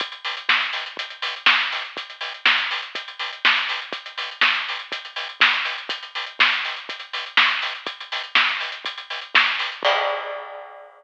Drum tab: CC |----------------|----------------|----------------|----------------|
HH |xxox-xoxxxox-xox|xxox-xoxxxox-xox|xxox-xoxxxox-xox|xxox-xoxxxox-xox|
SD |----o-------o---|----o-------o---|----o-------o---|----o-------o---|
BD |o---o---o---o---|o---o---o---o---|o---o---o---o---|o---o---o---o---|

CC |----------------|x---------------|
HH |xxox-xoxxxox-xox|----------------|
SD |----o-------o---|----------------|
BD |o---o---o---o---|o---------------|